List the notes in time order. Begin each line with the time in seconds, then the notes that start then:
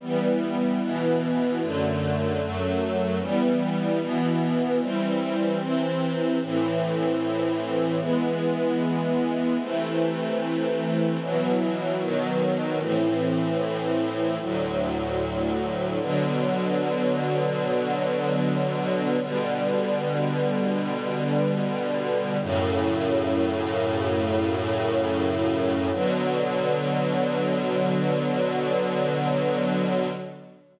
0.01 E3 G3 B3
0.81 B2 E3 B3
1.61 F#2 D3 A3
2.40 F#2 F#3 A3
3.20 E3 G3 B3
3.99 B2 E3 B3
4.79 E3 G3 C4
5.59 C3 E3 C4
6.41 A2 E3 C4
7.99 E3 G#3 B3
9.60 C3 E3 A3
11.20 B2 E3 F#3
12.00 B2 D#3 F#3
12.79 A2 E3 C4
14.40 D2 A2 F#3
16.00 B2 D3 F#3
19.20 B2 D3 G3
22.41 F#2 A2 C#3
25.92 B2 D3 F#3